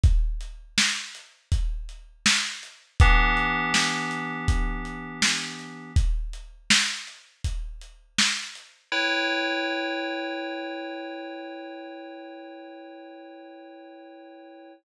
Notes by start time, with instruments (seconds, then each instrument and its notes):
0.03 kick, closed hi-hat
0.41 closed hi-hat
0.78 snare
1.15 closed hi-hat
1.52 kick, closed hi-hat
1.89 closed hi-hat
2.26 snare
2.63 closed hi-hat
3.00 electric piano 2 E3 B3 D4 G4, kick, closed hi-hat
3.37 closed hi-hat
3.74 snare
4.11 closed hi-hat
4.48 kick, closed hi-hat
4.85 closed hi-hat
5.22 snare
5.59 closed hi-hat
5.96 kick, closed hi-hat
6.33 closed hi-hat
6.70 snare
7.07 closed hi-hat
7.44 kick, closed hi-hat
7.81 closed hi-hat
8.18 snare
8.55 closed hi-hat
8.92 electric piano 2 E4 B4 C#5 G5